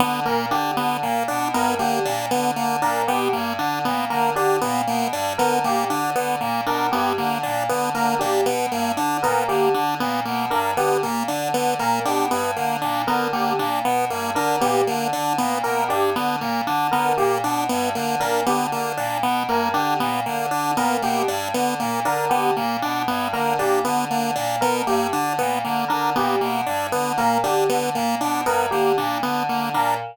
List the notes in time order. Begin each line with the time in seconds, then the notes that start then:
0.00 D3 B3
0.25 A#2 A#3 A#4
0.51 D3 D4 G4
0.77 D3 B3
1.02 A#2 A#3
1.28 B2 D4
1.53 G2 B3 A#4
1.79 D3 A#3 G4
2.05 A#2 D4
2.31 D3 B3
2.56 D3 A#3
2.82 A#2 D4 A#4
3.08 B2 B3 G4
3.33 G2 A#3
3.58 D3 D4
3.85 A#2 B3
4.10 D3 A#3 A#4
4.36 D3 D4 G4
4.61 A#2 B3
4.87 B2 A#3
5.12 G2 D4
5.38 D3 B3 A#4
5.64 A#2 A#3 G4
5.90 D3 D4
6.15 D3 B3
6.41 A#2 A#3
6.66 B2 D4 A#4
6.92 G2 B3 G4
7.18 D3 A#3
7.43 A#2 D4
7.69 D3 B3
7.94 D3 A#3 A#4
8.19 A#2 D4 G4
8.46 B2 B3
8.72 G2 A#3
8.97 D3 D4
9.23 A#2 B3 A#4
9.48 D3 A#3 G4
9.74 D3 D4
10.00 A#2 B3
10.25 B2 A#3
10.50 G2 D4 A#4
10.77 D3 B3 G4
11.02 A#2 A#3
11.28 D3 D4
11.54 D3 B3
11.79 A#2 A#3 A#4
12.05 B2 D4 G4
12.31 G2 B3
12.56 D3 A#3
12.82 A#2 D4
13.07 D3 B3 A#4
13.33 D3 A#3 G4
13.59 A#2 D4
13.84 B2 B3
14.10 G2 A#3
14.35 D3 D4 A#4
14.61 A#2 B3 G4
14.87 D3 A#3
15.13 D3 D4
15.38 A#2 B3
15.63 B2 A#3 A#4
15.89 G2 D4 G4
16.15 D3 B3
16.41 A#2 A#3
16.66 D3 D4
16.91 D3 B3 A#4
17.18 A#2 A#3 G4
17.43 B2 D4
17.69 G2 B3
17.95 D3 A#3
18.20 A#2 D4 A#4
18.46 D3 B3 G4
18.72 D3 A#3
18.97 A#2 D4
19.23 B2 B3
19.49 G2 A#3 A#4
19.74 D3 D4 G4
19.99 A#2 B3
20.26 D3 A#3
20.51 D3 D4
20.77 A#2 B3 A#4
21.02 B2 A#3 G4
21.28 G2 D4
21.54 D3 B3
21.80 A#2 A#3
22.05 D3 D4 A#4
22.30 D3 B3 G4
22.57 A#2 A#3
22.82 B2 D4
23.08 G2 B3
23.33 D3 A#3 A#4
23.59 A#2 D4 G4
23.85 D3 B3
24.10 D3 A#3
24.36 A#2 D4
24.61 B2 B3 A#4
24.87 G2 A#3 G4
25.12 D3 D4
25.39 A#2 B3
25.64 D3 A#3
25.88 D3 D4 A#4
26.16 A#2 B3 G4
26.41 B2 A#3
26.66 G2 D4
26.92 D3 B3
27.17 A#2 A#3 A#4
27.44 D3 D4 G4
27.69 D3 B3
27.95 A#2 A#3
28.21 B2 D4
28.46 G2 B3 A#4
28.71 D3 A#3 G4
28.97 A#2 D4
29.23 D3 B3
29.49 D3 A#3
29.74 A#2 D4 A#4